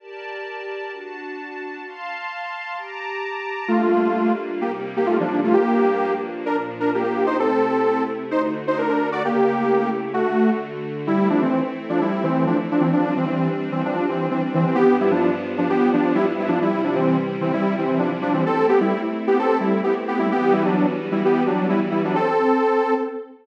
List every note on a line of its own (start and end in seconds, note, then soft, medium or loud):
0.00 0.91 G4 medium
0.00 0.91 A#4 medium
0.00 0.91 D5 medium
0.00 0.91 A5 medium
0.92 1.84 D4 medium
0.92 1.84 F#4 medium
0.92 1.84 A5 medium
1.85 2.76 F5 medium
1.85 2.76 A5 medium
1.85 2.76 C6 medium
2.77 3.68 G4 medium
2.77 3.68 A5 medium
2.77 3.68 A#5 medium
2.77 3.68 D6 medium
3.68 4.60 G3 medium
3.68 4.32 A3 medium
3.68 4.60 A#3 medium
3.68 4.61 D4 medium
3.68 4.32 F4 medium
3.68 4.61 F4 medium
4.61 5.52 C3 medium
4.61 5.52 G3 medium
4.61 5.52 A#3 medium
4.61 4.72 A#3 medium
4.61 5.52 D#4 medium
4.61 4.72 G4 medium
4.97 5.08 A#3 medium
4.97 5.08 G4 medium
5.06 5.17 A3 medium
5.06 5.17 F4 medium
5.20 5.41 F3 medium
5.20 5.41 D4 medium
5.44 5.55 A3 medium
5.44 5.55 F4 medium
5.53 6.45 G2 medium
5.53 6.45 F3 medium
5.53 6.13 A#3 medium
5.53 6.45 A#3 medium
5.53 6.45 D4 medium
5.53 6.13 G4 loud
6.46 7.37 A#2 medium
6.46 7.37 F3 medium
6.46 6.57 D4 medium
6.46 7.37 D4 medium
6.46 6.57 A#4 medium
6.80 6.91 D4 medium
6.80 6.91 A#4 medium
6.95 7.03 A#3 medium
6.95 7.03 G4 medium
7.03 7.26 A#3 medium
7.03 7.26 G4 medium
7.26 7.37 D#4 medium
7.26 7.37 C5 medium
7.38 8.29 C3 medium
7.38 8.29 A3 medium
7.38 8.03 C4 medium
7.38 8.29 E4 medium
7.38 8.03 A4 loud
8.31 9.23 D3 medium
8.31 9.21 A3 medium
8.31 8.42 D#4 medium
8.31 9.23 F#4 medium
8.31 8.42 C5 medium
8.67 8.78 D#4 medium
8.67 8.78 C5 medium
8.78 8.88 D4 medium
8.78 8.88 A#4 medium
8.89 9.09 D4 medium
8.89 9.09 A#4 medium
9.12 9.23 F#4 medium
9.12 9.23 D5 medium
9.22 10.13 C#3 medium
9.22 10.13 A3 medium
9.22 9.90 A#3 medium
9.22 10.13 E4 medium
9.22 10.13 G4 medium
9.22 9.90 G4 loud
10.14 11.07 D3 medium
10.14 10.51 A3 medium
10.14 11.07 A3 medium
10.14 10.51 F#4 loud
10.14 11.07 F#4 medium
11.07 11.29 G3 loud
11.07 12.90 A3 medium
11.07 12.90 C4 medium
11.07 11.29 E4 loud
11.07 12.90 E4 medium
11.30 11.41 F3 medium
11.30 11.41 D4 loud
11.42 11.61 E3 medium
11.42 11.61 C4 loud
11.89 12.00 F3 loud
11.89 12.00 D4 loud
12.01 12.24 G3 medium
12.01 12.24 E4 loud
12.23 12.45 E3 loud
12.23 12.45 C4 loud
12.47 12.57 F3 medium
12.47 12.57 D4 loud
12.71 12.82 F3 medium
12.71 12.82 D4 loud
12.80 12.91 E3 medium
12.80 12.91 C4 medium
12.92 13.14 F3 medium
12.92 14.75 G3 medium
12.92 14.75 C4 medium
12.92 14.75 D4 medium
12.92 13.14 D4 loud
13.17 13.26 E3 medium
13.17 13.26 C4 medium
13.27 13.49 E3 medium
13.27 13.49 C4 medium
13.72 13.82 E3 medium
13.72 13.82 C4 loud
13.85 14.06 F3 medium
13.85 14.06 D4 loud
14.09 14.28 E3 medium
14.09 14.28 C4 medium
14.31 14.42 E3 medium
14.31 14.42 C4 loud
14.54 14.65 E3 loud
14.54 14.65 C4 loud
14.66 14.77 E3 medium
14.66 14.77 C4 loud
14.75 16.59 G2 medium
14.75 16.59 F3 medium
14.75 14.97 B3 loud
14.75 16.59 B3 loud
14.75 16.59 D4 medium
14.75 14.97 G4 loud
15.01 15.12 G3 medium
15.01 15.12 E4 loud
15.11 15.30 F3 medium
15.11 15.30 D4 loud
15.58 15.69 F3 medium
15.58 15.69 D4 loud
15.69 15.90 B3 medium
15.69 15.90 G4 loud
15.93 16.13 F3 medium
15.93 16.13 D4 loud
16.15 16.26 G3 loud
16.15 16.26 E4 loud
16.39 16.50 G3 medium
16.39 16.50 E4 loud
16.48 16.59 F3 medium
16.48 16.59 D4 loud
16.60 18.43 C3 medium
16.60 18.43 G3 medium
16.60 16.82 G3 medium
16.60 18.43 E4 medium
16.60 16.82 E4 loud
16.84 16.95 F3 medium
16.84 16.95 D4 medium
16.95 17.17 E3 medium
16.95 17.17 C4 loud
17.41 17.52 E3 loud
17.41 17.52 C4 loud
17.53 17.76 G3 loud
17.53 17.76 E4 loud
17.78 17.99 E3 medium
17.78 17.99 C4 loud
17.99 18.10 F3 medium
17.99 18.10 D4 loud
18.22 18.33 F3 loud
18.22 18.33 D4 loud
18.33 18.44 E3 medium
18.33 18.44 C4 loud
18.46 20.30 A3 medium
18.46 18.67 C4 loud
18.46 20.30 C4 medium
18.46 20.30 E4 medium
18.46 18.67 A4 loud
18.69 18.80 B3 loud
18.69 18.80 G4 loud
18.80 19.01 G3 medium
18.80 19.01 E4 loud
19.27 19.38 B3 medium
19.27 19.38 G4 loud
19.39 19.58 C4 medium
19.39 19.58 A4 loud
19.60 19.81 G3 medium
19.60 19.81 E4 medium
19.83 19.94 B3 medium
19.83 19.94 G4 medium
20.08 20.19 B3 medium
20.08 20.19 G4 loud
20.19 20.30 G3 medium
20.19 20.30 E4 loud
20.30 22.13 E3 medium
20.30 22.13 G3 medium
20.30 22.13 B3 medium
20.30 20.53 B3 loud
20.30 22.13 F#4 medium
20.30 20.53 G4 loud
20.52 20.63 G3 loud
20.52 20.63 E4 loud
20.65 20.86 F#3 medium
20.65 20.86 D4 loud
21.12 21.23 G3 medium
21.12 21.23 E4 medium
21.25 21.43 B3 medium
21.25 21.43 G4 loud
21.47 21.67 F#3 medium
21.47 21.67 D4 medium
21.69 21.80 G3 medium
21.69 21.80 E4 loud
21.91 22.02 G3 medium
21.91 22.02 E4 medium
22.05 22.16 F#3 medium
22.05 22.16 D4 loud
22.15 22.94 C4 loud
22.15 22.94 A4 loud